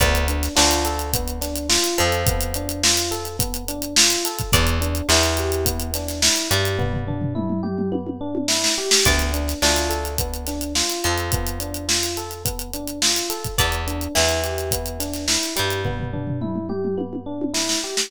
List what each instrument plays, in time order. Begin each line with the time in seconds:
0.00 electric bass (finger) D2, electric piano 1 B3, acoustic guitar (steel) D5, kick, closed hi-hat
0.15 closed hi-hat
0.28 electric piano 1 D4, closed hi-hat
0.43 snare, closed hi-hat
0.56 electric bass (finger) D2, acoustic guitar (steel) D4, electric piano 1 F4, snare
0.71 closed hi-hat
0.85 electric piano 1 A4, closed hi-hat
0.99 closed hi-hat
1.13 electric piano 1 B3, kick, closed hi-hat
1.28 closed hi-hat
1.41 electric piano 1 D4, snare, closed hi-hat
1.56 closed hi-hat
1.69 electric piano 1 F4, snare
1.84 closed hi-hat
1.98 electric bass (finger) F2, acoustic guitar (steel) F3, electric piano 1 A4, closed hi-hat
2.12 closed hi-hat
2.27 electric piano 1 B3, kick, closed hi-hat
2.41 closed hi-hat
2.54 electric piano 1 D4, closed hi-hat
2.69 closed hi-hat
2.83 electric piano 1 F4, snare
2.97 closed hi-hat
3.11 electric piano 1 A4, closed hi-hat
3.25 closed hi-hat
3.39 electric piano 1 B3, kick, closed hi-hat
3.54 closed hi-hat
3.68 electric piano 1 D4, closed hi-hat
3.82 closed hi-hat
3.96 electric piano 1 F4, snare
4.10 closed hi-hat
4.25 electric piano 1 A4, closed hi-hat
4.39 kick, closed hi-hat
4.52 electric bass (finger) E2, electric piano 1 B3, acoustic guitar (steel) D5, kick, closed hi-hat
4.67 closed hi-hat
4.81 electric piano 1 D4, closed hi-hat
4.95 closed hi-hat
5.09 electric bass (finger) E2, acoustic guitar (steel) E3, electric piano 1 E4, snare
5.23 closed hi-hat
5.37 electric piano 1 G4, closed hi-hat
5.52 closed hi-hat
5.65 electric piano 1 B3, kick, closed hi-hat
5.80 closed hi-hat
5.94 electric piano 1 D4, snare, closed hi-hat
6.08 snare, closed hi-hat
6.22 electric piano 1 E4, snare
6.36 snare, closed hi-hat
6.51 electric bass (finger) G2, acoustic guitar (steel) G3, electric piano 1 G4, closed hi-hat
6.65 closed hi-hat
6.79 electric piano 1 B3, kick, floor tom
6.93 floor tom
7.07 electric piano 1 D4, floor tom
7.21 floor tom
7.35 electric piano 1 E4, mid tom
7.50 mid tom
7.63 electric piano 1 G4, mid tom
7.78 mid tom
7.92 electric piano 1 B3, high tom
8.07 high tom
8.21 electric piano 1 D4
8.35 high tom
8.48 electric piano 1 E4, snare
8.64 snare
8.78 electric piano 1 G4
8.91 snare
9.05 electric bass (finger) D2, electric piano 1 B3, acoustic guitar (steel) D5, kick, closed hi-hat
9.19 closed hi-hat
9.34 electric piano 1 D4, closed hi-hat
9.48 snare, closed hi-hat
9.62 electric bass (finger) D2, acoustic guitar (steel) D4, electric piano 1 F4, snare
9.76 closed hi-hat
9.89 electric piano 1 A4, closed hi-hat
10.05 closed hi-hat
10.18 electric piano 1 B3, kick, closed hi-hat
10.34 closed hi-hat
10.47 electric piano 1 D4, snare, closed hi-hat
10.61 closed hi-hat
10.75 electric piano 1 F4, snare
10.90 closed hi-hat
11.04 electric bass (finger) F2, acoustic guitar (steel) F3, electric piano 1 A4, closed hi-hat
11.18 closed hi-hat
11.32 electric piano 1 B3, kick, closed hi-hat
11.47 closed hi-hat
11.60 electric piano 1 D4, closed hi-hat
11.74 closed hi-hat
11.88 electric piano 1 F4, snare
12.03 closed hi-hat
12.17 electric piano 1 A4, closed hi-hat
12.31 closed hi-hat
12.45 electric piano 1 B3, kick, closed hi-hat
12.59 closed hi-hat
12.73 electric piano 1 D4, closed hi-hat
12.88 closed hi-hat
13.02 electric piano 1 F4, snare
13.16 closed hi-hat
13.30 electric piano 1 A4, closed hi-hat
13.44 kick, closed hi-hat
13.58 electric bass (finger) E2, electric piano 1 B3, acoustic guitar (steel) D5, kick, closed hi-hat
13.72 closed hi-hat
13.87 electric piano 1 D4, closed hi-hat
14.01 closed hi-hat
14.15 electric bass (finger) E2, acoustic guitar (steel) E3, electric piano 1 E4, snare
14.29 closed hi-hat
14.44 electric piano 1 G4, closed hi-hat
14.58 closed hi-hat
14.71 electric piano 1 B3, kick, closed hi-hat
14.86 closed hi-hat
15.00 electric piano 1 D4, snare, closed hi-hat
15.14 snare, closed hi-hat
15.28 electric piano 1 E4, snare
15.42 snare, closed hi-hat
15.56 electric bass (finger) G2, acoustic guitar (steel) G3, electric piano 1 G4, closed hi-hat
15.70 closed hi-hat
15.85 electric piano 1 B3, kick, floor tom
16.00 floor tom
16.13 electric piano 1 D4, floor tom
16.27 floor tom
16.41 electric piano 1 E4, mid tom
16.56 mid tom
16.69 electric piano 1 G4, mid tom
16.84 mid tom
16.97 electric piano 1 B3, high tom
17.13 high tom
17.26 electric piano 1 D4
17.42 high tom
17.54 electric piano 1 E4, snare
17.69 snare
17.84 electric piano 1 G4
17.97 snare